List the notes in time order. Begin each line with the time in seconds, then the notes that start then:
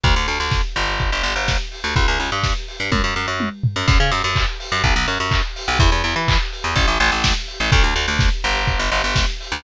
0.04 D2, kick, closed hi-hat
0.16 D2
0.27 D2, open hi-hat
0.40 D2
0.51 kick, snare
0.76 G1, open hi-hat
0.99 kick, closed hi-hat
1.12 G1
1.23 G1, open hi-hat
1.36 G1
1.48 kick, snare
1.72 open hi-hat
1.84 D2
1.96 C#2, kick, closed hi-hat
2.08 C#2
2.20 C#2, open hi-hat
2.32 G2
2.43 kick, snare
2.68 open hi-hat
2.80 G2
2.92 F#2, kick, high tom
3.04 F#2
3.16 F#2
3.28 F#2
3.40 high tom
3.64 floor tom
3.76 F#2
3.88 F#2, kick, crash
4.00 C#3
4.11 F#2, open hi-hat
4.24 F#2
4.36 kick, clap
4.60 open hi-hat
4.72 F#2
4.84 B1, kick, closed hi-hat
4.96 B1
5.08 F#2, open hi-hat
5.20 F#2
5.31 kick, clap
5.56 open hi-hat
5.68 B1
5.79 E2, kick, closed hi-hat
5.92 E2
6.04 E2, open hi-hat
6.16 E3
6.28 kick, clap
6.53 open hi-hat
6.64 E2
6.76 A1, kick, closed hi-hat
6.88 A1
7.00 A1, open hi-hat
7.12 A1
7.24 kick, snare
7.48 open hi-hat
7.60 A1
7.72 D2, kick, closed hi-hat
7.84 D2
7.96 D2, open hi-hat
8.08 D2
8.19 kick, snare
8.44 G1, open hi-hat
8.67 kick, closed hi-hat
8.79 G1
8.92 G1, open hi-hat
9.04 G1
9.16 kick, snare
9.40 open hi-hat
9.52 D2